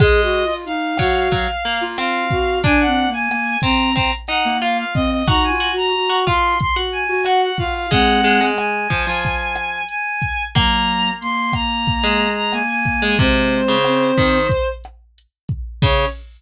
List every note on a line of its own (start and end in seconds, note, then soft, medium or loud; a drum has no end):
0.00 0.44 G#3 loud
0.00 0.21 G#4 loud
0.00 0.54 D#5 medium
0.00 kick loud
0.00 cross-stick medium
0.00 crash loud
0.22 0.43 F#4 loud
0.34 closed hi-hat medium
0.44 0.65 F4 medium
0.66 0.94 D#4 medium
0.66 1.83 F5 medium
0.66 closed hi-hat loud
0.97 1.28 F#3 medium
0.97 1.31 F#4 loud
0.97 kick medium
0.97 cross-stick loud
0.97 closed hi-hat medium
1.31 1.47 F#3 medium
1.31 kick medium
1.31 closed hi-hat loud
1.65 1.97 A#3 medium
1.65 closed hi-hat medium
1.81 2.24 F4 medium
1.98 2.62 C4 medium
1.98 2.59 F5 medium
1.98 cross-stick medium
1.98 closed hi-hat loud
2.30 2.59 F#4 loud
2.30 kick medium
2.30 closed hi-hat medium
2.63 2.84 D4 loud
2.63 3.10 D4 loud
2.63 2.79 G#5 medium
2.63 kick loud
2.63 closed hi-hat loud
2.80 3.09 F#5 medium
2.86 3.07 C4 loud
2.95 closed hi-hat medium
3.08 3.29 A#3 loud
3.13 3.58 G#5 medium
3.30 3.57 A#3 loud
3.30 cross-stick medium
3.30 closed hi-hat loud
3.61 3.90 C4 medium
3.61 3.95 C4 loud
3.61 3.93 A#5 medium
3.61 kick medium
3.61 closed hi-hat medium
3.95 4.11 C4 loud
3.95 4.11 A#5 medium
3.95 kick medium
3.95 closed hi-hat loud
4.27 4.57 D#4 loud
4.27 4.58 F#5 medium
4.27 cross-stick medium
4.27 closed hi-hat medium
4.45 4.85 A#3 loud
4.62 5.24 F4 medium
4.62 4.77 F5 medium
4.62 closed hi-hat loud
4.78 4.94 F5 medium
4.94 5.23 C4 loud
4.94 5.10 D#5 medium
4.94 kick medium
4.94 closed hi-hat medium
5.11 5.27 D#5 medium
5.27 5.49 D#4 loud
5.27 5.59 F#4 loud
5.27 5.43 A#5 medium
5.27 kick loud
5.27 cross-stick loud
5.27 closed hi-hat loud
5.44 5.71 G#5 medium
5.49 5.70 F4 medium
5.60 5.88 F#4 loud
5.60 closed hi-hat medium
5.71 5.92 F#4 loud
5.77 6.17 A#5 medium
5.93 6.25 F#4 medium
5.93 closed hi-hat loud
6.09 6.25 F#4 loud
6.26 6.55 F4 medium
6.26 6.59 F4 loud
6.26 6.57 C6 medium
6.26 kick medium
6.26 cross-stick medium
6.26 closed hi-hat medium
6.59 6.75 C6 medium
6.59 kick medium
6.59 closed hi-hat loud
6.76 7.04 F#4 loud
6.92 7.22 G#5 medium
6.92 closed hi-hat medium
7.09 7.49 F#4 medium
7.25 7.83 F#4 loud
7.25 7.41 F#5 medium
7.25 cross-stick medium
7.25 closed hi-hat loud
7.42 7.57 F#5 medium
7.57 7.87 F4 loud
7.57 7.74 F5 medium
7.57 kick medium
7.57 closed hi-hat medium
7.75 7.90 F5 medium
7.91 8.21 G#3 loud
7.91 8.51 G#3 loud
7.91 8.51 C4 loud
7.91 8.45 F#5 medium
7.91 kick medium
7.91 closed hi-hat loud
8.24 8.40 G#3 medium
8.24 closed hi-hat medium
8.41 8.88 G#3 medium
8.57 9.84 G#5 medium
8.57 cross-stick loud
8.57 closed hi-hat loud
8.90 9.06 F3 loud
8.90 kick medium
8.90 closed hi-hat medium
9.07 9.82 F3 loud
9.23 kick medium
9.23 closed hi-hat loud
9.55 cross-stick loud
9.55 closed hi-hat medium
9.89 10.45 G#5 medium
9.89 closed hi-hat loud
10.22 kick medium
10.22 closed hi-hat medium
10.55 11.11 F#3 loud
10.55 11.11 A#3 loud
10.55 11.69 A#3 loud
10.55 11.10 A#5 medium
10.55 kick loud
10.55 cross-stick loud
10.55 closed hi-hat loud
10.88 closed hi-hat medium
11.21 12.27 A#3 medium
11.21 11.52 C6 medium
11.21 closed hi-hat loud
11.53 12.30 A#5 medium
11.53 kick medium
11.53 cross-stick medium
11.53 closed hi-hat medium
11.86 kick medium
11.86 closed hi-hat loud
12.04 12.63 G#3 loud
12.20 closed hi-hat medium
12.36 12.52 A#5 medium
12.52 13.16 A#3 loud
12.52 12.68 G#5 medium
12.52 cross-stick medium
12.52 closed hi-hat loud
12.69 13.15 G#5 medium
12.85 kick medium
12.85 closed hi-hat medium
13.02 13.18 G#3 loud
13.18 13.61 C3 loud
13.18 13.76 G#3 loud
13.18 13.76 C4 loud
13.18 14.68 C5 medium
13.18 kick loud
13.18 closed hi-hat medium
13.51 closed hi-hat medium
13.68 14.12 C#3 loud
13.84 14.38 C4 loud
13.84 cross-stick medium
13.84 closed hi-hat loud
14.18 14.47 D#3 loud
14.18 kick medium
14.18 closed hi-hat medium
14.49 kick medium
14.49 closed hi-hat loud
14.84 cross-stick medium
14.84 closed hi-hat medium
15.18 closed hi-hat loud
15.49 kick medium
15.49 closed hi-hat medium
15.82 16.05 C#3 loud
15.82 16.05 C#4 loud
15.82 16.05 C#5 loud
15.82 kick loud
15.82 crash loud